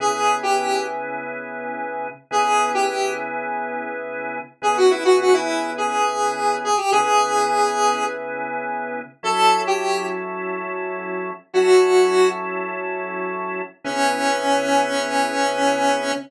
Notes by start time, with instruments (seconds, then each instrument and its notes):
0.00 drawbar organ C#3 B3 E4 G#4, lead 1 (square) G#4
0.43 lead 1 (square) G4
2.31 drawbar organ C#3 B3 E4 G#4, lead 1 (square) G#4
2.74 lead 1 (square) G4
4.62 drawbar organ C#3 B3 E4 G#4, lead 1 (square) G#4
4.77 lead 1 (square) F#4
4.90 lead 1 (square) E4
5.04 lead 1 (square) F#4
5.20 lead 1 (square) F#4
5.33 lead 1 (square) E4
5.78 lead 1 (square) G#4
6.64 lead 1 (square) G#4
6.77 lead 1 (square) G4
6.91 drawbar organ C#3 B3 E4 G#4, lead 1 (square) G#4
9.23 drawbar organ F#3 C#4 E4 A4, lead 1 (square) A4
9.67 lead 1 (square) G4
11.53 drawbar organ F#3 C#4 E4 A4, lead 1 (square) F#4
13.84 drawbar organ C#3 B3 E4 G#4, lead 1 (square) C#4